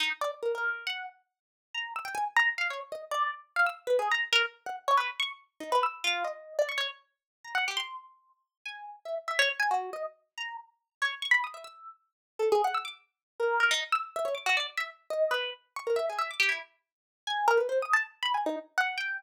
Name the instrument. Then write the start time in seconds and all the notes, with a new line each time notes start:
orchestral harp
0.00 D#4
0.21 D5
0.43 A#4
0.55 A#4
0.87 F#5
1.74 A#5
1.96 E6
2.05 G5
2.15 G#5
2.37 A#5
2.58 F5
2.70 C#5
2.92 D#5
3.11 D5
3.56 F5
3.66 E6
3.87 B4
3.99 G#4
4.12 A#5
4.33 A#4
4.66 F#5
4.88 C#5
4.97 B4
5.20 C#6
5.60 D#4
5.72 B4
5.83 E6
6.04 F4
6.24 D#5
6.59 D5
6.69 C#6
6.78 C#5
7.44 A#5
7.55 F#5
7.68 G4
7.77 C6
8.65 G#5
9.05 E5
9.28 E5
9.39 C#5
9.60 G#5
9.71 F#4
9.93 D#5
10.38 A#5
11.02 C#5
11.22 C#6
11.31 B5
11.44 D#6
11.54 E5
11.64 E6
12.39 A4
12.52 G#4
12.64 F#5
12.74 E6
12.85 D6
13.40 A#4
13.60 A#4
13.71 D#4
13.92 E6
14.16 E5
14.25 C#5
14.35 D6
14.46 F#4
14.57 D5
14.77 E5
15.10 D#5
15.31 B4
15.76 C#6
15.87 A#4
15.96 E5
16.10 G#4
16.19 E5
16.31 D6
16.40 G4
16.49 E4
17.27 G#5
17.48 A#4
17.57 B4
17.69 C5
17.82 D#6
17.93 A5
18.23 B5
18.34 G#5
18.46 D#4
18.78 F#5
18.98 G5